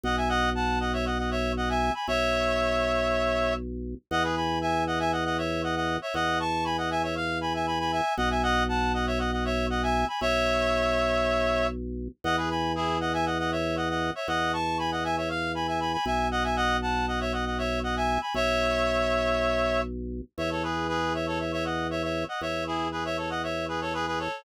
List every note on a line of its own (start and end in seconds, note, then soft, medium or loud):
0.03 1.91 B1 loud
0.03 0.16 D#5 medium
0.03 0.16 F#5 medium
0.17 0.29 E5 medium
0.17 0.29 G#5 medium
0.29 0.50 D#5 medium
0.29 0.50 F#5 loud
0.55 0.79 F#5 medium
0.55 0.79 A5 medium
0.80 0.92 D#5 medium
0.80 0.92 F#5 medium
0.93 1.05 C#5 medium
0.93 1.05 E5 medium
1.06 1.18 D#5 medium
1.06 1.18 F#5 medium
1.18 1.30 D#5 medium
1.18 1.30 F#5 medium
1.31 1.52 C#5 medium
1.31 1.52 E5 medium
1.57 1.69 D#5 medium
1.57 1.69 F#5 medium
1.69 1.92 E5 medium
1.69 1.92 G#5 medium
1.94 2.07 G#5 medium
1.94 2.07 B5 medium
2.08 3.95 B1 medium
2.08 3.54 C#5 loud
2.08 3.54 E5 loud
4.11 5.98 E2 loud
4.11 4.23 D#5 medium
4.11 4.23 F#5 loud
4.23 4.35 G#4 medium
4.23 4.35 B4 medium
4.36 4.59 G#5 medium
4.36 4.59 B5 medium
4.61 4.84 E5 medium
4.61 4.84 G#5 medium
4.87 4.99 D#5 medium
4.87 4.99 F#5 medium
4.99 5.11 E5 medium
4.99 5.11 G#5 medium
5.12 5.24 D#5 medium
5.12 5.24 F#5 medium
5.25 5.37 D#5 medium
5.25 5.37 F#5 medium
5.38 5.62 C#5 medium
5.38 5.62 E5 medium
5.63 5.75 D#5 medium
5.63 5.75 F#5 medium
5.76 5.97 D#5 medium
5.76 5.97 F#5 medium
6.02 6.14 C#5 medium
6.02 6.14 E5 medium
6.14 8.01 E2 loud
6.14 6.39 D#5 medium
6.14 6.39 F#5 loud
6.40 6.64 A5 medium
6.40 6.64 C#6 medium
6.65 6.77 G#5 medium
6.65 6.77 B5 medium
6.78 6.90 D#5 medium
6.78 6.90 F#5 medium
6.90 7.02 E5 medium
6.90 7.02 G#5 medium
7.03 7.15 C#5 medium
7.03 7.15 E5 medium
7.16 7.38 F5 medium
7.41 7.53 G#5 medium
7.41 7.53 B5 medium
7.54 7.66 E5 medium
7.54 7.66 G#5 medium
7.67 7.79 G#5 medium
7.67 7.79 B5 medium
7.80 7.91 G#5 medium
7.80 7.92 B5 medium
7.92 8.14 E5 medium
7.92 8.14 G#5 medium
8.17 10.05 B1 loud
8.17 8.29 D#5 medium
8.17 8.29 F#5 loud
8.30 8.42 E5 medium
8.30 8.42 G#5 medium
8.43 8.64 D#5 medium
8.43 8.64 F#5 loud
8.69 8.92 F#5 medium
8.69 8.92 A5 medium
8.94 9.06 D#5 medium
8.94 9.06 F#5 medium
9.07 9.19 C#5 medium
9.07 9.19 E5 medium
9.19 9.31 D#5 medium
9.19 9.31 F#5 medium
9.32 9.44 D#5 medium
9.32 9.44 F#5 medium
9.45 9.66 C#5 medium
9.45 9.66 E5 medium
9.70 9.82 D#5 medium
9.70 9.82 F#5 medium
9.83 10.05 E5 medium
9.83 10.05 G#5 medium
10.08 10.20 G#5 medium
10.08 10.20 B5 medium
10.21 12.08 B1 loud
10.21 11.67 C#5 loud
10.21 11.67 E5 loud
12.24 14.11 E2 loud
12.24 12.36 D#5 medium
12.24 12.36 F#5 loud
12.37 12.49 G#4 medium
12.37 12.49 B4 medium
12.50 12.72 G#5 medium
12.50 12.72 B5 medium
12.75 12.98 E4 medium
12.75 12.98 G#4 medium
13.00 13.13 D#5 medium
13.00 13.13 F#5 medium
13.13 13.25 E5 medium
13.13 13.25 G#5 medium
13.26 13.38 D#5 medium
13.26 13.38 F#5 medium
13.39 13.51 D#5 medium
13.39 13.51 F#5 medium
13.51 13.76 C#5 medium
13.51 13.76 E5 medium
13.76 13.89 D#5 medium
13.76 13.89 F#5 medium
13.89 14.10 D#5 medium
13.89 14.10 F#5 medium
14.15 14.27 C#5 medium
14.15 14.27 E5 medium
14.28 15.97 E2 loud
14.28 14.52 D#5 medium
14.28 14.52 F#5 medium
14.53 14.78 A5 medium
14.53 14.78 C#6 medium
14.78 14.91 G#5 medium
14.78 14.91 B5 medium
14.92 15.04 D#5 medium
14.92 15.04 F#5 medium
15.04 15.16 E5 medium
15.04 15.16 G#5 medium
15.17 15.29 C#5 medium
15.17 15.29 E5 medium
15.29 15.52 F5 medium
15.55 15.67 G#5 medium
15.55 15.67 B5 medium
15.67 15.80 E5 medium
15.67 15.80 G#5 medium
15.80 15.92 G#5 medium
15.80 15.92 B5 medium
15.93 16.05 G#5 medium
15.93 16.05 B5 medium
16.06 18.18 B1 loud
16.06 16.28 E5 medium
16.06 16.28 G#5 medium
16.31 16.43 D#5 medium
16.31 16.43 F#5 medium
16.44 16.56 E5 medium
16.44 16.56 G#5 medium
16.56 16.77 D#5 medium
16.56 16.77 F#5 loud
16.82 17.06 F#5 medium
16.82 17.06 A5 medium
17.08 17.20 D#5 medium
17.08 17.20 F#5 medium
17.20 17.32 C#5 medium
17.20 17.32 E5 medium
17.33 17.45 D#5 medium
17.33 17.45 F#5 medium
17.46 17.58 D#5 medium
17.46 17.58 F#5 medium
17.58 17.79 C#5 medium
17.58 17.79 E5 medium
17.83 17.95 D#5 medium
17.83 17.95 F#5 medium
17.96 18.19 E5 medium
17.96 18.19 G#5 medium
18.21 18.33 G#5 medium
18.21 18.33 B5 medium
18.34 20.22 B1 medium
18.34 19.81 C#5 loud
18.34 19.81 E5 loud
20.38 22.25 E2 loud
20.38 20.50 C#5 medium
20.38 20.50 E5 medium
20.51 20.63 A4 medium
20.51 20.63 C#5 medium
20.63 20.87 G#4 medium
20.63 20.87 B4 medium
20.89 21.13 G#4 medium
20.89 21.13 B4 medium
21.14 21.26 C#5 medium
21.14 21.26 E5 medium
21.27 21.39 A4 medium
21.27 21.39 C#5 medium
21.40 21.52 C#5 medium
21.40 21.52 E5 medium
21.52 21.64 C#5 medium
21.52 21.64 E5 medium
21.65 21.87 D#5 medium
21.65 21.87 F#5 medium
21.90 22.02 C#5 medium
21.90 22.02 E5 medium
22.03 22.24 C#5 medium
22.03 22.24 E5 medium
22.28 22.41 D#5 medium
22.28 22.41 F#5 medium
22.41 24.28 E2 medium
22.41 22.64 C#5 medium
22.41 22.64 E5 medium
22.67 22.88 E4 medium
22.67 22.88 G#4 medium
22.92 23.04 G#4 medium
22.92 23.04 B4 medium
23.05 23.17 C#5 medium
23.05 23.17 E5 medium
23.17 23.29 A4 medium
23.17 23.29 C#5 medium
23.30 23.42 D#5 medium
23.30 23.42 F#5 medium
23.43 23.66 C#5 medium
23.43 23.66 E5 medium
23.68 23.80 G#4 medium
23.68 23.80 B4 medium
23.81 23.93 A4 medium
23.81 23.93 C#5 medium
23.94 24.06 G#4 medium
23.94 24.06 B4 medium
24.07 24.19 G#4 medium
24.07 24.19 B4 medium
24.19 24.43 A4 medium
24.19 24.43 C#5 medium